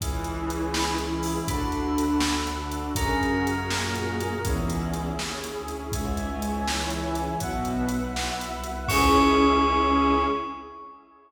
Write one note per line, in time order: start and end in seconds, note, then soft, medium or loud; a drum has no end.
0.00 1.36 C#2 medium
0.00 0.87 E3 medium
0.00 0.10 C#4 medium
0.00 1.47 C#4 medium
0.00 0.10 E4 medium
0.00 0.87 E4 medium
0.00 1.47 E4 medium
0.00 0.10 G#4 medium
0.00 1.47 G#4 medium
0.00 kick medium
0.00 closed hi-hat medium
0.24 0.35 C#4 medium
0.24 0.35 E4 medium
0.24 0.35 G#4 medium
0.24 closed hi-hat medium
0.49 0.59 C#4 medium
0.49 0.59 E4 medium
0.49 0.59 G#4 medium
0.49 closed hi-hat medium
0.73 0.83 C#4 medium
0.73 0.83 E4 medium
0.73 0.83 G#4 medium
0.73 1.48 B5 soft
0.73 snare loud
0.98 1.43 E3 medium
0.98 1.09 C#4 medium
0.98 1.43 E4 medium
0.98 1.09 E4 medium
0.98 1.09 G#4 medium
0.98 closed hi-hat medium
1.23 1.33 C#4 medium
1.23 1.33 E4 medium
1.23 1.33 G#4 medium
1.23 open hi-hat medium
1.48 2.85 D2 medium
1.48 2.28 D3 medium
1.48 1.58 D4 medium
1.48 2.28 D4 medium
1.48 2.96 D4 medium
1.48 1.58 F#4 medium
1.48 2.95 F#4 medium
1.48 1.58 A4 medium
1.48 2.96 A4 medium
1.48 2.90 B5 medium
1.48 kick loud
1.48 closed hi-hat medium
1.72 1.83 D4 medium
1.72 1.83 F#4 medium
1.72 1.83 A4 medium
1.72 closed hi-hat medium
1.98 2.08 D4 medium
1.98 2.08 F#4 medium
1.98 2.08 A4 medium
1.98 closed hi-hat medium
2.20 2.33 D4 medium
2.20 2.33 F#4 medium
2.20 2.33 A4 medium
2.20 snare loud
2.47 2.93 D3 medium
2.47 2.57 D4 medium
2.47 2.93 D4 medium
2.47 2.57 F#4 medium
2.47 2.57 A4 medium
2.47 closed hi-hat medium
2.72 2.82 D4 medium
2.72 2.82 F#4 medium
2.72 2.82 A4 medium
2.72 closed hi-hat medium
2.95 4.32 F#2 medium
2.95 3.45 C#3 medium
2.95 3.05 C#4 medium
2.95 4.42 C#4 medium
2.95 3.45 C#4 medium
2.95 3.05 F#4 medium
2.95 4.42 F#4 medium
2.95 3.05 G#4 medium
2.95 4.42 G#4 medium
2.95 3.05 A#4 medium
2.95 4.42 A#4 medium
2.95 4.45 A#5 medium
2.95 kick loud
2.95 closed hi-hat loud
3.21 3.31 C#4 medium
3.21 3.31 F#4 medium
3.21 3.31 G#4 medium
3.21 3.31 A#4 medium
3.21 closed hi-hat medium
3.45 3.55 C#4 medium
3.45 3.55 F#4 medium
3.45 3.55 G#4 medium
3.45 3.55 A#4 medium
3.45 closed hi-hat medium
3.70 4.41 A#2 medium
3.70 4.41 A#3 medium
3.70 3.80 C#4 medium
3.70 3.80 F#4 medium
3.70 3.80 G#4 medium
3.70 3.80 A#4 medium
3.70 snare loud
3.94 4.04 C#4 medium
3.94 4.04 F#4 medium
3.94 4.04 G#4 medium
3.94 4.04 A#4 medium
3.94 closed hi-hat medium
4.20 4.30 C#4 medium
4.20 4.30 F#4 medium
4.20 4.30 G#4 medium
4.20 4.30 A#4 medium
4.20 closed hi-hat medium
4.44 5.14 C#2 medium
4.44 5.06 E2 medium
4.44 5.06 E3 medium
4.44 4.54 C#4 medium
4.44 5.92 C#4 medium
4.44 4.54 E4 medium
4.44 5.92 E4 medium
4.44 4.54 G#4 medium
4.44 5.92 G#4 medium
4.44 kick loud
4.44 closed hi-hat medium
4.69 4.79 C#4 medium
4.69 4.79 E4 medium
4.69 4.79 G#4 medium
4.69 closed hi-hat medium
4.93 5.03 C#4 medium
4.93 5.03 E4 medium
4.93 5.03 G#4 medium
4.93 closed hi-hat medium
5.17 5.52 D#2 medium
5.17 5.27 C#4 medium
5.17 5.27 E4 medium
5.17 5.27 G#4 medium
5.17 snare medium
5.43 5.53 C#4 medium
5.43 5.53 E4 medium
5.43 5.53 G#4 medium
5.43 closed hi-hat medium
5.56 5.89 D2 medium
5.68 5.78 C#4 medium
5.68 5.78 E4 medium
5.68 5.78 G#4 medium
5.68 closed hi-hat medium
5.92 7.29 C#2 medium
5.92 6.16 G#2 medium
5.92 6.16 G#3 medium
5.92 6.03 C#4 medium
5.92 6.03 E4 medium
5.92 6.03 G#4 medium
5.92 7.39 C#5 medium
5.92 7.39 E5 medium
5.92 7.39 G#5 medium
5.92 kick loud
5.92 closed hi-hat medium
6.16 6.65 G#2 medium
6.16 6.65 G#3 medium
6.16 6.26 C#4 medium
6.16 6.26 E4 medium
6.16 6.26 G#4 medium
6.16 closed hi-hat medium
6.41 6.51 C#4 medium
6.41 6.51 E4 medium
6.41 6.51 G#4 medium
6.41 closed hi-hat medium
6.66 6.91 E3 medium
6.66 6.76 C#4 medium
6.66 6.76 E4 medium
6.66 6.91 E4 medium
6.66 6.76 G#4 medium
6.66 snare loud
6.90 7.15 E3 medium
6.90 7.01 C#4 medium
6.90 7.01 E4 medium
6.90 7.15 E4 medium
6.90 7.01 G#4 medium
6.90 closed hi-hat medium
7.15 7.37 E3 medium
7.15 7.26 C#4 medium
7.15 7.37 E4 medium
7.15 7.26 E4 medium
7.15 7.26 G#4 medium
7.15 closed hi-hat medium
7.40 8.11 B1 medium
7.40 7.85 B2 medium
7.40 7.50 B3 medium
7.40 7.85 B3 medium
7.40 7.50 E4 medium
7.40 7.50 F#4 medium
7.40 8.88 B4 medium
7.40 8.88 E5 medium
7.40 8.88 F#5 medium
7.40 kick medium
7.40 closed hi-hat medium
7.65 7.76 B3 medium
7.65 7.76 E4 medium
7.65 7.76 F#4 medium
7.65 closed hi-hat medium
7.89 8.00 B3 medium
7.89 8.00 E4 medium
7.89 8.00 F#4 medium
7.89 closed hi-hat medium
8.14 8.49 B1 medium
8.14 8.24 B3 medium
8.14 8.24 E4 medium
8.14 8.24 F#4 medium
8.14 snare loud
8.40 8.50 B3 medium
8.40 8.50 E4 medium
8.40 8.50 F#4 medium
8.40 closed hi-hat medium
8.52 8.85 C2 medium
8.64 8.74 B3 medium
8.64 8.74 E4 medium
8.64 8.74 F#4 medium
8.64 closed hi-hat medium
8.88 10.23 C#2 loud
8.88 10.23 C#4 loud
8.88 10.24 C#4 medium
8.88 10.23 E4 loud
8.88 10.24 E4 medium
8.88 10.23 G#4 loud
8.88 10.24 G#4 loud
8.88 10.23 C#6 loud
8.88 kick loud
8.88 crash loud